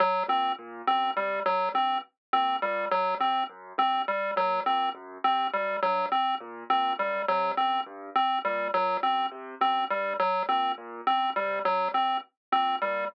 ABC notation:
X:1
M:9/8
L:1/8
Q:3/8=69
K:none
V:1 name="Acoustic Grand Piano" clef=bass
z ^A,, A,, ^F,, C, F,, G,, z A,, | ^A,, ^F,, C, F,, G,, z A,, A,, F,, | C, ^F,, G,, z ^A,, A,, F,, C, F,, | G,, z ^A,, A,, ^F,, C, F,, G,, z |
^A,, A,, ^F,, C, F,, G,, z A,, A,, |]
V:2 name="Lead 1 (square)"
^F, C z C G, F, C z C | G, ^F, C z C G, F, C z | C G, ^F, C z C G, F, C | z C G, ^F, C z C G, F, |
C z C G, ^F, C z C G, |]